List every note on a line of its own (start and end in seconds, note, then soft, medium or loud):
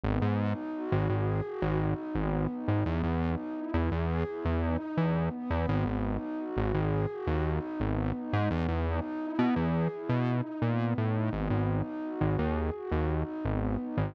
0.04 0.19 G#1 loud
0.04 0.36 B3 loud
0.22 0.53 G#2 loud
0.39 0.71 D#4 medium
0.74 1.06 F#4 loud
0.92 1.08 G#1 loud
1.09 1.41 G#1 medium
1.09 1.43 G#4 medium
1.45 1.76 F#4 loud
1.62 1.94 G#1 loud
1.80 2.12 D#4 medium
2.15 2.47 G#1 medium
2.15 2.49 B3 medium
2.50 2.82 D#4 medium
2.68 2.84 G#1 medium
2.85 3.02 E2 loud
2.85 3.16 B3 loud
3.04 3.35 E2 loud
3.21 3.53 D#4 medium
3.57 3.88 E4 medium
3.74 3.90 E2 medium
3.92 4.24 E2 loud
3.92 4.24 G#4 medium
4.27 4.59 E4 medium
4.45 4.77 E2 medium
4.62 4.94 D#4 medium
4.96 5.29 E2 medium
4.96 5.28 B3 medium
5.33 6.00 B3 loud
5.50 5.66 E2 medium
5.69 5.85 G#1 loud
5.86 6.17 G#1 loud
6.04 6.35 D#4 medium
6.38 6.70 F#4 medium
6.57 6.73 G#1 loud
6.74 7.06 G#1 loud
6.74 7.06 G#4 medium
7.11 7.43 F#4 loud
7.27 7.59 D#2 loud
7.45 7.77 D#4 medium
7.79 8.12 G#1 medium
7.79 8.11 B3 medium
8.15 8.47 D#4 medium
8.33 8.49 G#2 loud
8.51 8.67 E2 loud
8.51 8.83 B3 loud
8.68 9.00 E2 loud
8.87 9.19 D#4 loud
9.21 9.53 E4 medium
9.39 9.55 B2 medium
9.56 9.88 E2 medium
9.56 9.87 G#4 medium
9.92 10.24 E4 medium
10.09 10.41 B2 medium
10.27 10.59 D#4 medium
10.62 10.94 A#2 medium
10.62 10.95 B3 medium
10.98 11.30 A2 medium
10.98 11.30 D#4 medium
11.33 11.49 G#1 loud
11.33 11.65 B3 loud
11.50 11.82 G#1 medium
11.69 12.01 D#4 medium
12.04 12.36 F#4 medium
12.21 12.37 G#1 medium
12.38 12.70 D#2 medium
12.38 12.70 G#4 medium
12.74 13.05 F#4 medium
12.92 13.23 D#2 medium
13.10 13.42 D#4 medium
13.44 13.77 G#1 medium
13.44 13.76 B3 medium
13.81 14.13 D#4 medium
13.97 14.13 G#1 medium